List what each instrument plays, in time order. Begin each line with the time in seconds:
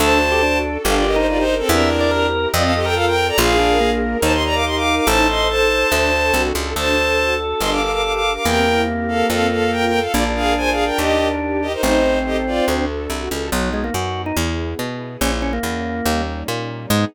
0.00 electric bass (finger) D2, string ensemble 1 D4 F#4 A4, drawbar organ A4, violin C5 A5
0.22 string ensemble 1 A4
0.32 drawbar organ G4
0.42 drawbar organ D4, string ensemble 1 F#4
0.64 string ensemble 1 A4
0.84 electric bass (finger) G1, string ensemble 1 D4 G4 A#4, drawbar organ G4, violin A4 F5
0.95 violin F4 D5
1.06 violin G4 D#5, string ensemble 1 A#4
1.16 drawbar organ D#4, violin D#4 C5
1.27 violin F4 D5, string ensemble 1 G4
1.37 violin D#4 C5
1.47 string ensemble 1 A#4
1.59 violin C4 A4
1.68 electric bass (finger) E2, string ensemble 1 C4 E4 G4 A#4, violin D4 A#4, drawbar organ E5
1.90 string ensemble 1 E4
2.01 drawbar organ D5
2.11 string ensemble 1 G4, drawbar organ A#4
2.33 string ensemble 1 A#4
2.53 electric bass (finger) F2, string ensemble 1 C4 F4 A4, violin F4 D5, drawbar organ D#5
2.63 violin A4 F5
2.75 violin G4 D#5, string ensemble 1 A4
2.85 violin A#4 G5, drawbar organ A#4
2.95 string ensemble 1 F4, violin A4 F5
3.06 violin A#4 G5
3.17 string ensemble 1 A4
3.28 violin D5 A#5
3.37 electric bass (finger) A#1, string ensemble 1 D4 F4 G#4 A#4, drawbar organ F4, violin G#4 F5
3.59 drawbar organ D4, string ensemble 1 A#4
3.80 drawbar organ A#3, string ensemble 1 G#4
4.02 string ensemble 1 A#4
4.22 electric bass (finger) D#2, drawbar organ D#4, string ensemble 1 D#4 G4 A#4, violin C5 A5
4.33 violin D#5 C6
4.43 string ensemble 1 A#4, violin D5 A#5
4.55 violin F5 D6
4.65 string ensemble 1 G4, violin D#5 C6
4.75 violin F5 D6
4.87 string ensemble 1 A#4
4.97 violin F5 D6
5.07 electric bass (finger) A1, string ensemble 1 D#4 A4 C5, drawbar organ A4, violin C5 A5
5.28 string ensemble 1 C5, violin D#5 C6
5.48 string ensemble 1 A4, violin C5 A5
5.70 string ensemble 1 C5
5.92 electric bass (finger) D2, string ensemble 1 D4 F#4 A4
6.13 string ensemble 1 A4
6.34 electric bass (finger) C2, string ensemble 1 F#4
6.55 electric bass (finger) C#2, string ensemble 1 A4
6.76 electric bass (finger) D2, string ensemble 1 D4 F#4 A4, drawbar organ A4, violin C5 A5
6.97 string ensemble 1 A4
7.18 string ensemble 1 F#4
7.40 string ensemble 1 A4
7.60 electric bass (finger) G1, string ensemble 1 D4 G4 A#4, violin D#5 C6
7.71 violin F5 D6
7.81 string ensemble 1 A#4, violin F5 D6
7.92 violin F5 D6
8.03 string ensemble 1 G4, violin F5 D6
8.13 violin F5 D6
8.24 string ensemble 1 A#4
8.35 violin F5 D6
8.45 electric bass (finger) E2, drawbar organ A#3, string ensemble 1 C4 E4 G4 A#4, violin A#4 G5
8.67 string ensemble 1 E4
8.88 string ensemble 1 G4
9.08 violin A4 F5, string ensemble 1 A#4
9.28 electric bass (finger) F2, string ensemble 1 C4 F4 A4, violin A4 F5
9.51 violin A4 F5, string ensemble 1 A4
9.71 string ensemble 1 F4, violin A#4 G5
9.86 violin A#4 G5
9.93 string ensemble 1 A4
9.99 violin A4 F5
10.13 electric bass (finger) A#1, string ensemble 1 D4 F4 G#4 A#4, drawbar organ D4, violin F4 D5
10.35 violin G#4 F5, string ensemble 1 A#4
10.57 string ensemble 1 G#4, violin C5 G#5
10.71 violin G#4 F5
10.77 string ensemble 1 A#4
10.85 violin A#4 G5
10.98 electric bass (finger) D#2, string ensemble 1 D#4 G4 A#4, violin G4 D#5
11.19 string ensemble 1 A#4
11.41 string ensemble 1 G4
11.62 violin G4 D#5, string ensemble 1 A#4
11.73 violin D#4 C5
11.82 electric bass (finger) A1, drawbar organ C4, violin D#4 C5, string ensemble 1 D#4 A4 C5
12.05 string ensemble 1 C5
12.25 violin G4 D#5, string ensemble 1 A4
12.46 violin F4 D5, string ensemble 1 C5
12.67 electric bass (finger) D2, string ensemble 1 D4 F#4 A4
12.89 string ensemble 1 A4
13.10 electric bass (finger) C2, string ensemble 1 F#4
13.30 electric bass (finger) C#2, string ensemble 1 A4
13.52 electric bass (finger) B1, drawbar organ F#3, string ensemble 1 B3 D#4 F#4
13.73 drawbar organ G#3
13.84 drawbar organ A#3
13.94 electric bass (finger) F#2, drawbar organ F#4
14.26 drawbar organ D#4
14.36 electric bass (finger) E2, string ensemble 1 B3 E4 G#4
14.79 electric bass (finger) B2
15.21 electric bass (finger) A#1, string ensemble 1 A#3 C#4 E4, drawbar organ C#4
15.42 drawbar organ C#4
15.53 drawbar organ A#3
15.63 electric bass (finger) E2
16.06 electric bass (finger) D#2, string ensemble 1 G3 A#3 C#4 D#4
16.48 electric bass (finger) A#2
16.90 electric bass (finger) G#2, drawbar organ G#3, string ensemble 1 B3 D#4 G#4